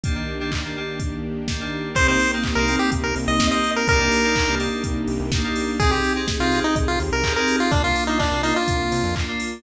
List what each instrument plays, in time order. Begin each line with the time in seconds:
0.04 electric piano 2 D#3 A#3 D4 G4, string ensemble 1 D#3 A#3 D4 G4, kick, closed hi-hat
0.15 electric piano 2 D#3 A#3 D4 G4
0.40 electric piano 2 D#3 A#3 D4 G4
0.52 kick, clap
0.64 electric piano 2 D#3 A#3 D4 G4
0.76 electric piano 2 D#3 A#3 D4 G4
1.00 kick, closed hi-hat
1.48 electric piano 2 D#3 A#3 D4 G4, kick, snare
1.60 electric piano 2 D#3 A#3 D4 G4
1.94 synth bass 1 C2, electric piano 2 A#3 C4 D#4 G4, string ensemble 1 A#3 C4 D#4 G4, lead 1 (square) C5, kick, closed hi-hat
2.07 electric piano 2 A#3 C4 D#4 G4, lead 1 (square) C5
2.20 open hi-hat
2.33 electric piano 2 A#3 C4 D#4 G4
2.44 kick, clap
2.55 synth bass 1 C2, electric piano 2 A#3 C4 D#4 G4, lead 1 (square) A#4
2.68 electric piano 2 A#3 C4 D#4 G4, open hi-hat
2.79 lead 1 (square) G4
2.92 synth bass 1 C2, kick, closed hi-hat
3.04 lead 1 (square) A#4
3.16 synth bass 1 C2, open hi-hat
3.28 synth bass 1 C2, lead 1 (square) D#5
3.40 electric piano 2 A#3 C4 D#4 G4, kick, snare
3.51 electric piano 2 A#3 C4 D#4 G4, lead 1 (square) D#5
3.64 open hi-hat
3.76 lead 1 (square) A#4
3.88 synth bass 1 C2, string ensemble 1 A#3 D4 D#4 G4, electric piano 2 A#3 D4 D#4 G4, lead 1 (square) A#4, kick, closed hi-hat
4.00 electric piano 2 A#3 D4 D#4 G4
4.12 open hi-hat
4.24 electric piano 2 A#3 D4 D#4 G4
4.36 kick, clap
4.47 synth bass 1 C2, electric piano 2 A#3 D4 D#4 G4
4.59 electric piano 2 A#3 D4 D#4 G4, open hi-hat
4.84 synth bass 1 C2, kick, closed hi-hat
5.08 synth bass 1 C2, open hi-hat
5.20 synth bass 1 C2
5.32 electric piano 2 A#3 D4 D#4 G4, kick, snare
5.44 electric piano 2 A#3 D4 D#4 G4
5.55 open hi-hat
5.79 synth bass 1 C2, electric piano 2 C4 D#4 G4 G#4, string ensemble 1 C4 D#4 G4 G#4, lead 1 (square) G#4, kick, closed hi-hat
5.91 electric piano 2 C4 D#4 G4 G#4, lead 1 (square) G4
6.04 open hi-hat
6.16 electric piano 2 C4 D#4 G4 G#4
6.28 kick, snare
6.40 synth bass 1 C2, electric piano 2 C4 D#4 G4 G#4, lead 1 (square) F4
6.52 electric piano 2 C4 D#4 G4 G#4, open hi-hat
6.64 lead 1 (square) D#4
6.76 synth bass 1 C2, kick, closed hi-hat
6.88 lead 1 (square) F4
7.00 synth bass 1 D#2, open hi-hat
7.12 synth bass 1 C2, lead 1 (square) A#4
7.24 electric piano 2 C4 D#4 G4 G#4, kick, clap
7.36 electric piano 2 C4 D#4 G4 G#4, lead 1 (square) A#4
7.48 open hi-hat
7.60 lead 1 (square) F4
7.71 synth bass 1 C2, electric piano 2 A#3 D4 F4, string ensemble 1 A#3 D4 F4, lead 1 (square) D4, kick, closed hi-hat
7.84 electric piano 2 A#3 D4 F4, lead 1 (square) F4
7.96 open hi-hat
8.07 electric piano 2 A#3 D4 F4, lead 1 (square) D#4
8.19 lead 1 (square) D4, kick, clap
8.32 synth bass 1 C2, electric piano 2 A#3 D4 F4
8.43 electric piano 2 A#3 D4 F4, lead 1 (square) D#4, open hi-hat
8.56 lead 1 (square) F4
8.68 synth bass 1 C2, kick, closed hi-hat
8.92 synth bass 1 C3, open hi-hat
9.04 synth bass 1 F2
9.15 electric piano 2 A#3 D4 F4, kick, clap
9.28 electric piano 2 A#3 D4 F4
9.40 open hi-hat